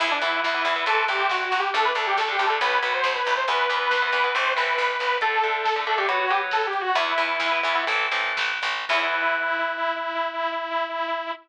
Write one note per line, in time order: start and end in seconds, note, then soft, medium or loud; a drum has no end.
0.00 0.19 E2 loud
0.00 0.17 E3 medium
0.00 0.17 B3 medium
0.00 0.10 E4 loud
0.00 kick loud
0.00 crash medium
0.11 0.21 D4 loud
0.11 kick medium
0.21 0.40 E2 loud
0.21 0.48 E3 medium
0.21 0.48 B3 medium
0.21 0.41 E4 medium
0.21 kick medium
0.21 closed hi-hat medium
0.33 kick medium
0.43 0.63 E2 medium
0.43 0.85 E4 medium
0.43 kick medium
0.43 snare loud
0.54 0.63 E3 medium
0.54 0.63 B3 medium
0.54 kick medium
0.65 0.83 E2 loud
0.65 0.74 E3 medium
0.65 0.74 B3 medium
0.65 kick medium
0.65 closed hi-hat medium
0.76 0.85 E3 medium
0.76 0.85 B3 medium
0.76 kick medium
0.86 1.05 C2 medium
0.86 1.04 E3 medium
0.86 1.04 A3 medium
0.86 1.04 C4 medium
0.86 1.07 A4 loud
0.86 kick medium
0.86 closed hi-hat medium
0.97 kick medium
1.08 1.27 C2 loud
1.08 1.43 E3 medium
1.08 1.43 A3 medium
1.08 1.43 C4 medium
1.08 1.27 G4 medium
1.08 kick medium
1.08 closed hi-hat medium
1.19 kick medium
1.29 1.49 C2 medium
1.29 1.44 F#4 medium
1.29 kick medium
1.29 snare loud
1.40 kick medium
1.45 1.59 F#4 medium
1.52 1.70 C2 loud
1.52 kick medium
1.52 closed hi-hat medium
1.59 1.73 G4 medium
1.64 kick medium
1.74 1.93 D2 loud
1.74 1.91 D3 medium
1.74 1.91 A3 medium
1.74 1.84 A4 loud
1.74 kick medium
1.74 closed hi-hat medium
1.85 1.95 B4 loud
1.85 kick medium
1.95 2.14 D2 loud
1.95 2.22 D3 medium
1.95 2.22 A3 medium
1.95 2.06 A4 medium
1.95 kick medium
1.95 closed hi-hat medium
2.07 2.17 G4 medium
2.07 kick medium
2.17 2.36 D2 loud
2.17 2.31 A4 medium
2.17 kick medium
2.17 snare loud
2.28 2.37 D3 medium
2.28 2.37 A3 medium
2.28 2.46 G4 medium
2.28 kick medium
2.39 2.58 D2 loud
2.39 2.48 D3 medium
2.39 2.48 A3 medium
2.39 kick medium
2.39 closed hi-hat medium
2.46 2.59 D3 medium
2.46 2.59 A3 medium
2.46 2.60 A4 medium
2.51 kick medium
2.60 2.79 B1 loud
2.60 2.78 F#3 medium
2.60 2.78 B3 loud
2.60 2.79 B4 loud
2.60 kick medium
2.60 closed hi-hat loud
2.71 kick medium
2.82 3.01 B1 medium
2.82 3.17 F#3 medium
2.82 3.17 B3 medium
2.82 2.93 B4 loud
2.82 kick medium
2.82 closed hi-hat medium
2.94 3.14 C5 loud
2.94 kick medium
3.03 3.22 B1 loud
3.03 kick medium
3.03 snare loud
3.15 3.34 B4 loud
3.15 kick medium
3.26 3.45 B1 loud
3.26 kick medium
3.26 closed hi-hat medium
3.36 3.47 C5 loud
3.36 kick medium
3.48 3.67 E2 loud
3.48 3.65 E3 medium
3.48 3.65 B3 medium
3.48 3.76 B4 loud
3.48 kick medium
3.48 closed hi-hat loud
3.59 kick medium
3.69 3.88 E2 loud
3.69 3.96 E3 medium
3.69 3.96 B3 medium
3.69 kick medium
3.69 closed hi-hat medium
3.77 4.03 B4 loud
3.81 kick medium
3.91 4.09 E2 medium
3.91 kick medium
3.91 snare loud
4.02 4.11 E3 medium
4.02 4.11 B3 medium
4.02 4.34 B4 loud
4.02 kick medium
4.12 4.31 E2 loud
4.12 4.22 E3 medium
4.12 4.22 B3 medium
4.12 kick medium
4.12 closed hi-hat medium
4.24 4.33 E3 medium
4.24 4.33 B3 medium
4.24 kick medium
4.34 4.54 A1 loud
4.34 4.52 E3 medium
4.34 4.52 A3 loud
4.34 4.52 C4 medium
4.34 4.53 C5 medium
4.34 kick medium
4.34 closed hi-hat medium
4.46 kick medium
4.56 4.76 A1 loud
4.56 4.91 E3 medium
4.56 4.91 A3 medium
4.56 4.91 C4 medium
4.56 5.17 B4 loud
4.56 kick medium
4.56 closed hi-hat medium
4.68 kick medium
4.78 4.97 A1 loud
4.78 kick medium
4.78 closed hi-hat medium
4.89 kick medium
4.99 5.19 A1 medium
4.99 kick medium
4.99 closed hi-hat medium
5.11 kick medium
5.21 5.39 D3 medium
5.21 5.39 A3 loud
5.21 5.80 A4 loud
5.21 kick medium
5.21 closed hi-hat loud
5.32 kick medium
5.43 5.70 D3 medium
5.43 5.70 A3 medium
5.43 kick medium
5.43 closed hi-hat medium
5.54 kick medium
5.65 kick medium
5.65 snare loud
5.76 5.85 D3 medium
5.76 5.85 A3 medium
5.76 kick medium
5.87 5.96 D3 medium
5.87 5.96 A3 medium
5.87 5.97 A4 medium
5.87 kick medium
5.87 closed hi-hat medium
5.98 6.07 D3 medium
5.98 6.07 A3 medium
5.98 6.08 G4 medium
5.98 kick medium
6.08 6.26 F#3 medium
6.08 6.26 B3 medium
6.08 6.19 F#4 medium
6.08 kick medium
6.08 closed hi-hat loud
6.20 6.30 F#4 loud
6.20 kick medium
6.29 6.65 F#3 medium
6.29 6.65 B3 medium
6.29 6.41 G4 loud
6.29 kick medium
6.29 closed hi-hat medium
6.41 kick medium
6.51 6.66 A4 loud
6.51 kick medium
6.51 snare loud
6.63 kick medium
6.67 6.81 G4 loud
6.73 kick medium
6.73 closed hi-hat medium
6.81 6.95 F#4 loud
6.85 kick medium
6.95 7.14 E2 loud
6.95 7.13 E3 loud
6.95 7.13 B3 medium
6.95 7.84 E4 loud
6.95 kick loud
6.95 closed hi-hat loud
7.07 kick medium
7.18 7.37 E2 loud
7.18 7.45 E3 medium
7.18 7.45 B3 medium
7.18 kick medium
7.18 closed hi-hat medium
7.29 kick medium
7.40 7.59 E2 loud
7.40 kick medium
7.40 snare loud
7.52 7.61 E3 medium
7.52 7.61 B3 medium
7.52 kick medium
7.63 7.85 E2 loud
7.63 7.73 E3 medium
7.63 7.73 B3 medium
7.63 kick medium
7.63 closed hi-hat medium
7.75 7.85 E3 medium
7.75 7.85 B3 medium
7.75 kick medium
7.87 8.09 A1 loud
7.87 8.07 E3 loud
7.87 8.07 A3 loud
7.87 8.07 C4 loud
7.87 kick medium
7.87 closed hi-hat medium
7.99 kick medium
8.11 8.33 A1 loud
8.11 8.52 E3 medium
8.11 8.52 A3 medium
8.11 8.52 C4 medium
8.11 kick medium
8.11 closed hi-hat medium
8.24 kick medium
8.37 8.60 A1 medium
8.37 kick medium
8.37 snare loud
8.50 kick medium
8.62 8.85 A1 loud
8.62 kick medium
8.62 closed hi-hat medium
8.76 kick medium
8.89 11.31 E2 loud
8.89 11.31 E3 loud
8.89 11.31 B3 loud
8.89 11.31 E4 loud
8.89 kick loud
8.89 crash loud